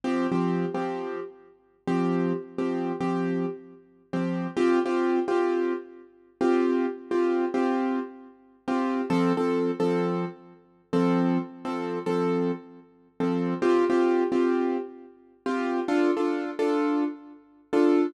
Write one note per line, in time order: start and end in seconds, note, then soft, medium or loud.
0.04 0.27 F3 medium
0.04 0.27 C4 medium
0.04 0.27 G4 loud
0.32 0.66 F3 medium
0.32 0.66 C4 medium
0.32 0.66 G4 medium
0.75 1.20 F3 medium
0.75 1.20 C4 medium
0.75 1.20 G4 medium
1.88 2.33 F3 medium
1.88 2.33 C4 medium
1.88 2.33 G4 medium
2.58 2.92 F3 medium
2.58 2.92 C4 medium
2.58 2.92 G4 medium
3.01 3.46 F3 medium
3.01 3.46 C4 medium
3.01 3.46 G4 medium
4.13 4.47 F3 medium
4.13 4.47 C4 medium
4.13 4.47 G4 medium
4.57 4.79 C4 loud
4.57 4.79 F4 medium
4.57 4.79 G4 loud
4.86 5.20 C4 medium
4.86 5.20 F4 medium
4.86 5.20 G4 medium
5.28 5.73 C4 medium
5.28 5.73 F4 medium
5.28 5.73 G4 medium
6.41 6.86 C4 medium
6.41 6.86 F4 medium
6.41 6.86 G4 medium
7.11 7.45 C4 medium
7.11 7.45 F4 medium
7.11 7.45 G4 medium
7.54 7.99 C4 medium
7.54 7.99 F4 medium
7.54 7.99 G4 medium
8.68 9.02 C4 medium
8.68 9.02 F4 medium
8.68 9.02 G4 medium
9.10 9.33 F3 loud
9.10 9.33 C4 loud
9.10 9.33 A4 loud
9.37 9.71 F3 medium
9.37 9.71 C4 medium
9.37 9.71 A4 medium
9.80 10.25 F3 medium
9.80 10.25 C4 medium
9.80 10.25 A4 medium
10.93 11.38 F3 medium
10.93 11.38 C4 loud
10.93 11.38 A4 medium
11.65 11.99 F3 medium
11.65 11.99 C4 medium
11.65 11.99 A4 medium
12.06 12.52 F3 medium
12.06 12.52 C4 medium
12.06 12.52 A4 medium
13.20 13.54 F3 medium
13.20 13.54 C4 medium
13.20 13.54 A4 medium
13.62 13.85 C4 loud
13.62 13.85 F4 medium
13.62 13.85 G4 loud
13.90 14.24 C4 medium
13.90 14.24 F4 medium
13.90 14.24 G4 medium
14.32 14.77 C4 medium
14.32 14.77 F4 medium
14.32 14.77 G4 medium
15.46 15.80 C4 medium
15.46 15.80 F4 medium
15.46 15.80 G4 medium
15.88 16.11 D4 medium
15.88 16.11 F4 loud
15.88 16.11 A4 medium
16.17 16.51 D4 medium
16.17 16.51 F4 medium
16.17 16.51 A4 medium
16.59 17.04 D4 medium
16.59 17.04 F4 medium
16.59 17.04 A4 medium
17.73 18.07 D4 medium
17.73 18.07 F4 medium
17.73 18.07 A4 medium